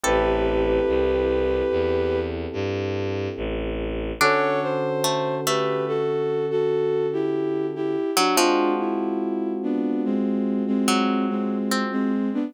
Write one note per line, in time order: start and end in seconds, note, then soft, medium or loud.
0.04 0.79 A1 loud
0.04 4.12 C4 loud
0.04 4.12 E4 medium
0.04 4.12 G4 loud
0.04 2.19 G4 medium
0.04 4.12 A4 loud
0.04 1.75 A4 medium
0.04 2.19 B4 medium
0.87 1.62 C2 medium
1.71 2.46 E2 medium
2.53 3.28 G2 loud
3.37 4.12 A1 loud
4.21 7.96 D3 loud
4.21 7.96 C#4 loud
4.21 4.89 D4 medium
4.21 7.96 F#4 loud
4.21 4.60 A4 medium
4.21 7.96 A4 loud
4.21 4.60 C#5 medium
4.63 5.35 C5 medium
5.04 5.41 A3 medium
5.46 7.23 A3 medium
5.46 5.84 G4 medium
5.46 5.84 B4 medium
5.88 6.46 F#4 medium
5.88 6.46 A4 medium
6.51 7.06 F#4 medium
6.51 7.06 A4 medium
7.13 7.66 E4 medium
7.13 7.66 G4 medium
7.75 8.11 E4 medium
7.75 8.11 G4 medium
8.17 8.37 F#3 medium
8.17 8.36 D4 medium
8.17 8.36 F#4 medium
8.37 10.65 F3 medium
8.37 12.12 G#3 loud
8.37 12.12 C4 loud
8.37 8.72 D4 medium
8.37 12.12 F4 loud
8.37 8.72 F4 medium
8.37 12.12 F#4 loud
8.79 9.52 E4 medium
9.63 10.02 B3 medium
9.63 10.02 D4 medium
10.05 10.63 G#3 medium
10.05 10.63 C4 medium
10.67 11.26 G#3 medium
10.67 11.26 C4 medium
10.88 11.58 F#3 medium
11.30 11.83 G#3 medium
11.30 11.83 C4 medium
11.72 12.45 C4 medium
11.92 12.29 G#3 medium
11.92 12.29 C4 medium
12.34 12.53 B3 medium
12.34 12.53 D4 medium